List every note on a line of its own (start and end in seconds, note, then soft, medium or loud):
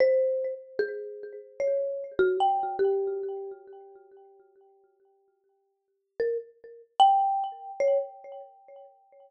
0.00 0.54 C5 loud
0.79 1.33 G#4 medium
1.60 2.14 C#5 medium
2.19 2.37 F#4 loud
2.40 2.76 G5 medium
2.79 3.51 G4 medium
6.20 6.38 A#4 medium
7.00 7.72 G5 loud
7.80 7.98 C#5 medium